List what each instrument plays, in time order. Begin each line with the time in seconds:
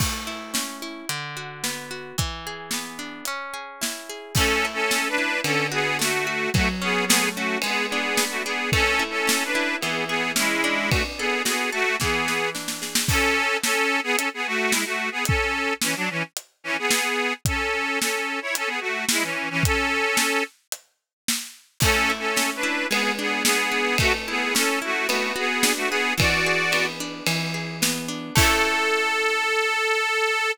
0.00 orchestral harp A3, kick, crash
0.27 orchestral harp E4
0.54 orchestral harp C#4, snare
0.82 orchestral harp E4
1.09 orchestral harp D3, closed hi-hat
1.37 orchestral harp F#4
1.64 orchestral harp B3, snare
1.91 orchestral harp F#4
2.18 orchestral harp E3, kick, closed hi-hat
2.47 orchestral harp G#4
2.71 orchestral harp B3, snare
2.99 orchestral harp D4
3.25 orchestral harp C#4, closed hi-hat
3.54 orchestral harp G#4
3.81 orchestral harp E4, snare
4.09 orchestral harp G#4
4.35 orchestral harp A3, accordion C#4 A4, kick, crash
4.65 orchestral harp E4
4.73 accordion C#4 A4
4.91 orchestral harp C#4, snare
5.08 accordion D4 B4
5.18 orchestral harp E4
5.44 orchestral harp D3, accordion C#4 A4, ride
5.72 accordion B3 G#4, orchestral harp F#4
5.99 orchestral harp A3, accordion A3 F#4, snare
6.27 orchestral harp F#4
6.54 orchestral harp F#3, accordion A3 F#4, kick, ride
6.82 accordion B3 G#4, orchestral harp C#4
7.07 orchestral harp A3, accordion B3 G#4, snare
7.35 accordion A3 F#4, orchestral harp C#4
7.62 orchestral harp G#3, accordion B3 G#4, ride
7.89 accordion B3 G#4, orchestral harp D4
8.17 orchestral harp B3, snare
8.30 accordion A3 F#4
8.44 accordion B3 G#4, orchestral harp D4
8.72 orchestral harp A3, accordion C#4 A4, kick, ride
8.99 orchestral harp E4
9.10 accordion C#4 A4
9.27 orchestral harp C#4, snare
9.45 accordion D4 B4
9.55 orchestral harp E4
9.80 orchestral harp E3, accordion B3 G#4, ride
10.07 accordion B3 G#4, orchestral harp G#4
10.36 accordion G#3 E4, orchestral harp C#4, snare
10.64 orchestral harp D4
10.90 accordion A3 F#4, kick, ride
11.18 accordion B3 G#4, orchestral harp A4
11.45 accordion B3 G#4, orchestral harp F#4, snare
11.72 accordion A3 F#4, orchestral harp A4
12.00 orchestral harp E3, accordion B3 G#4, kick, snare
12.28 orchestral harp B4, snare
12.55 orchestral harp D4, snare
12.68 snare
12.82 orchestral harp G#4, snare
12.95 snare
13.08 accordion C#4 A4, kick, crash
13.63 accordion C#4 A4, snare
14.03 accordion B3 G#4
14.16 accordion C#4 A4, closed hi-hat
14.34 accordion B3 G#4
14.46 accordion A3 F#4
14.71 accordion G#3 E4, snare
14.85 accordion A3 F#4
15.11 accordion B3 G#4
15.25 accordion C#4 A4, kick, closed hi-hat
15.81 accordion E3 C#4, snare
15.96 accordion F#3 D4
16.10 accordion E3 C#4
16.37 closed hi-hat
16.64 accordion E3 C#4
16.79 accordion B3 G#4
16.91 snare
17.45 accordion C#4 A4, kick, closed hi-hat
18.00 accordion C#4 A4, snare
18.42 accordion E4 C#5
18.55 accordion C#4 A4, closed hi-hat
18.67 accordion B3 G#4
18.80 accordion A3 F#4
19.09 accordion G#3 E4, snare
19.22 accordion E3 C#4
19.50 accordion E3 C#4
19.63 accordion C#4 A4, kick, closed hi-hat
20.17 snare
20.72 closed hi-hat
21.28 snare
21.80 orchestral harp A3, accordion C#4 A4, kick, crash
22.10 orchestral harp E4
22.19 accordion C#4 A4
22.36 orchestral harp C#4, snare
22.56 accordion D4 B4
22.63 orchestral harp E4
22.90 orchestral harp G#3, accordion B3 G#4, ride
23.19 accordion B3 G#4, orchestral harp D4
23.44 accordion B3 G#4, orchestral harp B3, snare
23.72 orchestral harp D4
23.98 orchestral harp A3, accordion A3 F#4, kick, ride
24.28 accordion B3 G#4, orchestral harp E4
24.55 orchestral harp C#4, accordion C#4 A4, snare
24.82 accordion A3 F#4, orchestral harp E4
25.08 accordion A3 F#4, orchestral harp B3, ride
25.36 accordion B3 G#4, orchestral harp F#4
25.63 orchestral harp D4, snare
25.76 accordion A3 F#4
25.89 accordion B3 G#4, orchestral harp F#4
26.18 orchestral harp E3, accordion F#4 D5, kick, ride
26.46 orchestral harp G#4
26.72 orchestral harp B3, ride
27.00 orchestral harp D4
27.26 orchestral harp E3, ride
27.54 orchestral harp G#4
27.82 orchestral harp B3, snare
28.08 orchestral harp D4
28.35 orchestral harp A3 C#4 E4, accordion A4, kick, crash